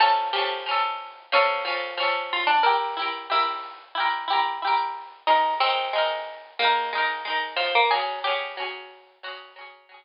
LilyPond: <<
  \new Staff \with { instrumentName = "Harpsichord" } { \time 4/4 \key bes \mixolydian \tempo 4 = 91 a'8 g'4. cis'4. f'16 d'16 | bes'4 e'2 r4 | ees'8 c'4. bes4. f16 bes16 | aes'8 g'4. ges'8 r4. | }
  \new Staff \with { instrumentName = "Harpsichord" } { \time 4/4 \key bes \mixolydian <f cis'>8 <f cis' a'>8 <f cis' a'>4 <f a'>8 <f cis' a'>8 <f cis' a'>4 | <e' g'>8 <e' g' bes'>8 <g' bes'>4 <e' g' bes'>8 <e' g' bes'>8 <e' g' bes'>4 | <aes bes'>8 <aes ees' bes'>8 <aes ees' bes'>4 <aes ees' bes'>8 <aes ees' bes'>8 <aes ees' bes'>4 | <ges des'>8 <ges des' aes'>8 <ges des' aes'>4 <ges des' aes'>8 <ges des' aes'>8 <ges des' aes'>4 | }
>>